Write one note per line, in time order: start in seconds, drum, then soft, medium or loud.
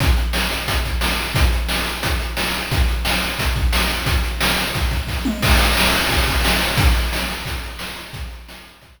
0.00 kick loud
0.00 closed hi-hat loud
0.17 closed hi-hat medium
0.33 snare loud
0.51 closed hi-hat medium
0.68 kick medium
0.68 closed hi-hat loud
0.85 kick medium
0.85 closed hi-hat medium
1.01 snare loud
1.19 closed hi-hat medium
1.35 kick loud
1.35 closed hi-hat loud
1.53 closed hi-hat medium
1.69 snare loud
1.86 closed hi-hat medium
2.03 kick medium
2.03 closed hi-hat loud
2.20 closed hi-hat medium
2.37 snare loud
2.55 closed hi-hat medium
2.71 kick loud
2.71 closed hi-hat loud
2.88 closed hi-hat medium
3.05 snare loud
3.22 closed hi-hat medium
3.39 kick medium
3.39 closed hi-hat loud
3.56 kick medium
3.56 closed hi-hat medium
3.73 snare loud
3.90 closed hi-hat medium
4.06 kick loud
4.06 closed hi-hat loud
4.24 closed hi-hat medium
4.41 snare loud
4.58 closed hi-hat medium
4.75 kick medium
4.75 closed hi-hat medium
4.91 kick medium
4.91 closed hi-hat medium
5.07 kick medium
5.07 snare medium
5.25 mid tom loud
5.43 kick loud
5.43 crash loud
5.58 closed hi-hat medium
5.77 snare loud
5.93 closed hi-hat medium
6.09 kick medium
6.09 closed hi-hat medium
6.27 kick medium
6.27 closed hi-hat medium
6.45 snare loud
6.60 closed hi-hat medium
6.77 kick loud
6.77 closed hi-hat loud
6.95 closed hi-hat medium
7.13 snare loud
7.28 closed hi-hat medium
7.45 kick medium
7.45 closed hi-hat loud
7.63 closed hi-hat medium
7.79 snare loud
7.96 closed hi-hat medium
8.13 kick loud
8.13 closed hi-hat loud
8.31 closed hi-hat medium
8.48 snare loud
8.65 closed hi-hat medium
8.81 kick medium
8.81 closed hi-hat loud
8.98 kick medium
8.98 closed hi-hat medium